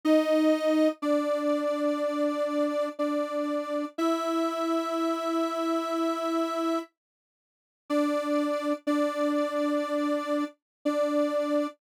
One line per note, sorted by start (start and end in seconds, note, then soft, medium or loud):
0.05 0.88 D#4 loud
0.05 0.88 D#5 loud
1.02 2.89 D4 medium
1.02 2.89 D5 medium
2.99 3.85 D4 medium
2.99 3.85 D5 medium
3.98 6.79 E4 medium
3.98 6.79 E5 loud
7.90 8.73 D4 medium
7.90 8.73 D5 loud
8.87 10.44 D4 medium
8.87 10.44 D5 loud
10.85 11.67 D4 medium
10.85 11.67 D5 medium